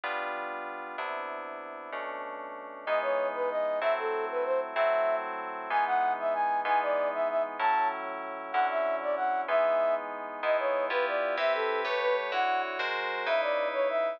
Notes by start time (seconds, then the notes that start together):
0.04 G3 B3 D4 F4
0.98 C3 B3 D4 E4
1.92 B2 A3 C#4 D4
2.86 E3 G#3 B3 D#4 D#5
3.02 C#5
3.34 B4
3.50 D#5
3.81 F#3 A3 C4 E4 E5
3.98 A4
4.31 B4
4.45 C5
4.75 F#3 A3 C4 E4 E5
5.70 E3 G#3 B3 D#4 G#5
5.86 F#5
6.19 E5
6.34 G#5
6.65 E3 G#3 B3 D#4 G#5
6.82 D5
7.13 E5
7.29 E5
7.59 A2 F#3 C#4 E4 A5
8.52 D3 F#3 C#4 E4 F#5
8.70 E5
9.02 D5
9.16 F#5
9.48 E3 G#3 B3 D#4 E5
10.43 G#3 B3 D#4 E4 D#5
10.59 C#5
10.90 B3 E4 F4 G4 B4
11.07 D5
11.37 C4 E4 G4 B4 E5
11.54 A4
11.85 A3 G4 B4 C#5
12.01 B4
12.32 D3 E4 F#4 C#5 F#5
12.79 G#3 F#4 A#4 C5
13.26 C#3 D#4 E4 B4 E5
13.42 D5
13.73 C#5
13.89 E5